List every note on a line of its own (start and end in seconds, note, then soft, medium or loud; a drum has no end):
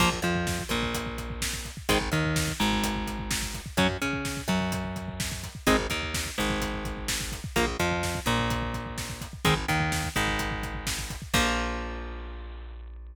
0.00 0.20 A#1 loud
0.00 0.09 F3 medium
0.00 0.09 A#3 medium
0.00 kick loud
0.00 crash loud
0.12 kick medium
0.22 0.62 F2 medium
0.22 0.64 F3 medium
0.22 kick medium
0.22 closed hi-hat medium
0.35 kick medium
0.47 kick medium
0.47 snare medium
0.59 kick medium
0.69 1.69 A#1 medium
0.69 1.71 A#2 medium
0.69 kick medium
0.69 closed hi-hat medium
0.83 kick medium
0.94 kick medium
0.94 closed hi-hat medium
1.06 kick medium
1.18 kick medium
1.18 closed hi-hat medium
1.30 kick medium
1.42 kick medium
1.42 snare loud
1.53 kick medium
1.65 kick medium
1.65 closed hi-hat soft
1.77 kick medium
1.89 2.09 G#1 loud
1.89 1.98 D#3 medium
1.89 1.98 G#3 medium
1.89 1.98 C4 medium
1.89 kick medium
1.89 closed hi-hat medium
2.01 kick medium
2.12 2.52 D#2 medium
2.12 2.53 D#3 medium
2.12 kick medium
2.12 closed hi-hat medium
2.24 kick medium
2.36 kick medium
2.36 snare loud
2.48 kick medium
2.60 3.62 G#1 medium
2.60 3.60 G#2 medium
2.60 kick medium
2.60 closed hi-hat medium
2.72 kick medium
2.83 kick medium
2.83 closed hi-hat loud
2.96 kick medium
3.07 kick medium
3.07 closed hi-hat medium
3.19 kick medium
3.31 kick medium
3.31 snare loud
3.42 kick medium
3.54 kick medium
3.54 closed hi-hat medium
3.66 kick medium
3.77 3.97 F#2 loud
3.77 3.87 F#3 medium
3.77 3.87 C#4 medium
3.77 kick medium
3.77 closed hi-hat medium
3.90 kick medium
4.01 4.42 C#3 medium
4.01 4.42 C#4 medium
4.01 kick medium
4.01 closed hi-hat medium
4.13 kick medium
4.25 kick medium
4.25 snare medium
4.37 kick medium
4.48 5.48 F#2 medium
4.48 5.49 F#3 medium
4.48 kick medium
4.48 closed hi-hat medium
4.61 kick medium
4.72 kick medium
4.72 closed hi-hat medium
4.84 kick medium
4.96 kick medium
4.96 closed hi-hat medium
5.08 kick medium
5.20 kick medium
5.20 snare loud
5.32 kick medium
5.43 kick medium
5.43 closed hi-hat medium
5.55 kick medium
5.67 5.87 G#1 loud
5.67 5.76 G#3 medium
5.67 5.76 C4 medium
5.67 5.76 D#4 medium
5.67 kick medium
5.67 closed hi-hat medium
5.79 kick medium
5.90 6.30 D#2 medium
5.90 6.31 D#3 medium
5.90 kick medium
5.90 closed hi-hat medium
6.02 kick medium
6.14 kick medium
6.14 snare loud
6.26 kick medium
6.38 7.40 G#1 medium
6.38 7.38 G#2 medium
6.38 kick medium
6.38 closed hi-hat medium
6.50 kick medium
6.61 kick medium
6.61 closed hi-hat medium
6.73 kick medium
6.85 kick medium
6.85 closed hi-hat medium
6.97 kick medium
7.08 kick medium
7.08 snare loud
7.20 kick medium
7.32 kick medium
7.32 closed hi-hat medium
7.44 kick medium
7.56 7.77 A#1 loud
7.56 7.65 F3 medium
7.56 7.65 A#3 medium
7.56 kick medium
7.56 closed hi-hat medium
7.67 kick medium
7.79 8.20 F2 medium
7.79 8.20 F3 medium
7.79 kick medium
7.79 closed hi-hat medium
7.91 kick medium
8.03 kick medium
8.03 snare medium
8.15 kick medium
8.26 9.26 A#1 medium
8.26 9.27 A#2 medium
8.26 kick medium
8.26 closed hi-hat medium
8.39 kick medium
8.50 kick medium
8.50 closed hi-hat medium
8.62 kick medium
8.74 kick medium
8.74 closed hi-hat medium
8.86 kick medium
8.98 kick medium
8.98 snare medium
9.09 kick medium
9.21 kick medium
9.21 closed hi-hat medium
9.33 kick medium
9.45 9.66 G#1 medium
9.45 9.54 D#3 medium
9.45 9.54 G#3 medium
9.45 9.54 C4 medium
9.45 kick loud
9.45 closed hi-hat medium
9.57 kick medium
9.68 10.09 D#2 medium
9.68 10.09 D#3 medium
9.68 kick medium
9.68 closed hi-hat medium
9.80 kick medium
9.92 kick medium
9.92 snare medium
10.04 kick medium
10.16 11.17 G#1 medium
10.16 11.16 G#2 medium
10.16 kick medium
10.16 closed hi-hat medium
10.28 kick medium
10.39 kick medium
10.39 closed hi-hat medium
10.51 kick medium
10.63 kick medium
10.63 closed hi-hat medium
10.75 kick medium
10.87 kick medium
10.87 snare loud
10.98 kick medium
11.10 kick medium
11.10 closed hi-hat medium
11.22 kick medium
11.34 13.14 A#1 loud
11.34 13.15 F3 medium
11.34 13.15 A#3 loud
11.34 kick loud
11.34 crash loud